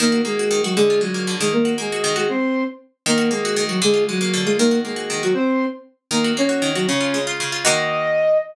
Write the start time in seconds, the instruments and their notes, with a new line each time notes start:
0.00 pizzicato strings D#3, flute A#3 A#4
0.12 pizzicato strings F#4
0.25 flute G#3 G#4, pizzicato strings A#3
0.39 pizzicato strings F#4
0.51 pizzicato strings D#3
0.64 flute F#3 F#4, pizzicato strings F#4
0.76 pizzicato strings D3, flute G#3 G#4
0.90 pizzicato strings F4
1.01 flute F#3 F#4, pizzicato strings G#3
1.14 pizzicato strings A#3
1.27 pizzicato strings D3
1.40 pizzicato strings D#3, flute G#3 G#4
1.53 flute A#3 A#4
1.65 pizzicato strings F#4
1.78 flute G#3 G#4, pizzicato strings A#3
1.92 pizzicato strings F#4
2.04 pizzicato strings D#3
2.16 flute G#3 G#4, pizzicato strings F#4
2.29 flute C4 C5
3.06 pizzicato strings D#3, flute A#3 A#4
3.18 pizzicato strings F#4
3.31 flute G#3 G#4, pizzicato strings A#3
3.45 pizzicato strings F#4
3.56 pizzicato strings D#3
3.69 flute F#3 F#4, pizzicato strings F#4
3.82 pizzicato strings D3, flute G#3 G#4
3.94 pizzicato strings F4
4.09 flute F#3 F#4, pizzicato strings G#3
4.21 pizzicato strings A#3
4.33 pizzicato strings D3
4.45 flute G#3 G#4, pizzicato strings F4
4.58 pizzicato strings D#3, flute A#3 A#4
4.71 pizzicato strings F#4
4.85 flute G#3 G#4, pizzicato strings A#3
4.96 pizzicato strings F#4
5.10 pizzicato strings D#3
5.23 flute F#3 F#4, pizzicato strings F#4
5.34 flute C4 C5
6.11 pizzicato strings D#3, flute A#3 A#4
6.24 pizzicato strings F#4
6.37 pizzicato strings A#3, flute C#4 C#5
6.49 pizzicato strings F#4
6.62 pizzicato strings D#3
6.75 flute F#3 F#4, pizzicato strings F#4
6.87 pizzicato strings C#3, flute C#4 C#5
7.01 pizzicato strings F4
7.14 pizzicato strings G#3
7.27 pizzicato strings F4
7.40 pizzicato strings C#3
7.52 pizzicato strings F4
7.64 pizzicato strings D#3 A#3 F#4, flute D#5